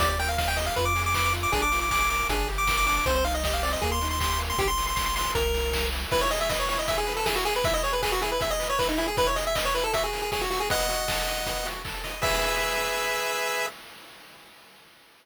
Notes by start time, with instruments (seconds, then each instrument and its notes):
0.00 synth bass 1 D#2, lead 1 (square) G4 D5, kick, closed hi-hat
0.09 lead 1 (square) D5
0.19 lead 1 (square) A#4 G5, open hi-hat
0.29 lead 1 (square) F5
0.38 lead 1 (square) D#5 F5, kick, snare
0.48 lead 1 (square) G5
0.57 lead 1 (square) G4 D#5, open hi-hat
0.66 lead 1 (square) F5
0.76 synth bass 1 F2, lead 1 (square) F4 B4, kick, closed hi-hat
0.85 lead 1 (square) D6
0.96 lead 1 (square) G#4, open hi-hat
1.06 lead 1 (square) D6
1.14 lead 1 (square) B4 D6, kick, clap
1.24 lead 1 (square) D6
1.33 lead 1 (square) F4, open hi-hat
1.43 lead 1 (square) D6
1.52 synth bass 1 A#1, lead 1 (square) D4 G#4, kick, closed hi-hat
1.62 lead 1 (square) D6
1.71 lead 1 (square) F4, open hi-hat
1.81 lead 1 (square) D6
1.91 lead 1 (square) G#4 D6, kick, clap
2.00 lead 1 (square) D6
2.10 lead 1 (square) A#4 D6, open hi-hat
2.29 synth bass 1 G1, lead 1 (square) D4 G#4, kick, closed hi-hat
2.47 lead 1 (square) G4, open hi-hat
2.58 lead 1 (square) D6
2.67 lead 1 (square) A#4, kick, snare
2.77 lead 1 (square) D6
2.86 lead 1 (square) D4 D6, open hi-hat
2.96 lead 1 (square) D6
3.06 synth bass 1 C2, lead 1 (square) C4 C5, kick, closed hi-hat
3.15 lead 1 (square) C5
3.25 lead 1 (square) D#4 F5, open hi-hat
3.34 lead 1 (square) D#5
3.44 lead 1 (square) G4 D#5, kick, snare
3.54 lead 1 (square) F5
3.63 lead 1 (square) C4 D5, open hi-hat
3.73 lead 1 (square) D#5
3.82 synth bass 1 D#2, lead 1 (square) A#3 G#4, kick, closed hi-hat
3.92 lead 1 (square) C6
4.01 lead 1 (square) D#4, open hi-hat
4.10 lead 1 (square) C6
4.20 lead 1 (square) G4 C6, kick, clap
4.31 lead 1 (square) C6
4.38 lead 1 (square) A#3, open hi-hat
4.50 lead 1 (square) C6
4.58 synth bass 1 A#1, lead 1 (square) G4, kick, closed hi-hat
4.68 lead 1 (square) C6
4.78 open hi-hat
4.87 lead 1 (square) C6
4.96 lead 1 (square) C6, kick, clap
5.06 lead 1 (square) C6
5.16 lead 1 (square) C6, open hi-hat
5.35 synth bass 1 C2, lead 1 (square) A#4, kick, closed hi-hat
5.54 open hi-hat
5.73 kick, snare
5.92 open hi-hat
6.11 lead 1 (square) E4 B4, kick, crash
6.21 lead 1 (square) C#5, closed hi-hat
6.31 lead 1 (square) G#4 D#5, open hi-hat
6.40 lead 1 (square) E5, closed hi-hat
6.49 lead 1 (square) B4 D#5, kick, snare
6.59 lead 1 (square) C#5, closed hi-hat
6.69 lead 1 (square) E4 C#5, open hi-hat
6.78 lead 1 (square) D#5, closed hi-hat
6.88 lead 1 (square) G#4 E5, kick, closed hi-hat
6.98 lead 1 (square) G#4, closed hi-hat
7.07 lead 1 (square) B4, open hi-hat
7.17 lead 1 (square) A4, closed hi-hat
7.26 lead 1 (square) E4 G#4, kick, snare
7.36 lead 1 (square) F#4, closed hi-hat
7.45 lead 1 (square) G#4, open hi-hat
7.55 lead 1 (square) B4, closed hi-hat
7.64 lead 1 (square) E4 E5, kick, closed hi-hat
7.74 lead 1 (square) D#5, closed hi-hat
7.83 lead 1 (square) G#4 C#5, open hi-hat
7.93 lead 1 (square) B4, closed hi-hat
8.02 lead 1 (square) G#4 B4, kick, clap
8.12 lead 1 (square) F#4, closed hi-hat
8.21 lead 1 (square) E4 G#4, open hi-hat
8.31 lead 1 (square) B4, closed hi-hat
8.40 lead 1 (square) G#4 E5, kick, closed hi-hat
8.50 lead 1 (square) D#5, closed hi-hat
8.59 lead 1 (square) B4, open hi-hat
8.70 lead 1 (square) C#5, closed hi-hat
8.79 lead 1 (square) E4 B4, kick, clap
8.89 lead 1 (square) D#4, closed hi-hat
8.98 lead 1 (square) E4 G#4, open hi-hat
9.08 lead 1 (square) G#4, closed hi-hat
9.17 lead 1 (square) E4 B4, kick, closed hi-hat
9.27 lead 1 (square) C#5, closed hi-hat
9.36 lead 1 (square) G#4 D#5, open hi-hat
9.46 lead 1 (square) E5, closed hi-hat
9.55 lead 1 (square) B4 D#5, kick, clap
9.65 lead 1 (square) C#5, closed hi-hat
9.75 lead 1 (square) E4 B4, open hi-hat
9.84 lead 1 (square) A4, closed hi-hat
9.93 lead 1 (square) F#4 E5, kick, closed hi-hat
10.03 lead 1 (square) G#4, closed hi-hat
10.13 lead 1 (square) A#4, open hi-hat
10.22 lead 1 (square) G#4, closed hi-hat
10.32 lead 1 (square) G#4 C#5, kick, snare
10.41 lead 1 (square) F#4, closed hi-hat
10.50 lead 1 (square) F#4, open hi-hat
10.60 lead 1 (square) G#4, closed hi-hat
10.70 lead 1 (square) B3 D#5 F#5, kick, closed hi-hat
10.80 closed hi-hat
10.89 lead 1 (square) F#4, open hi-hat
10.99 closed hi-hat
11.08 lead 1 (square) A4, kick, snare
11.18 closed hi-hat
11.27 lead 1 (square) D#5, open hi-hat
11.37 closed hi-hat
11.46 lead 1 (square) B3, kick, closed hi-hat
11.56 closed hi-hat
11.65 lead 1 (square) F#4, open hi-hat
11.75 closed hi-hat
11.85 lead 1 (square) A4, kick, clap
11.95 closed hi-hat
12.04 lead 1 (square) D#5, open hi-hat
12.13 closed hi-hat
12.22 lead 1 (square) G#4 B4 E5, kick, crash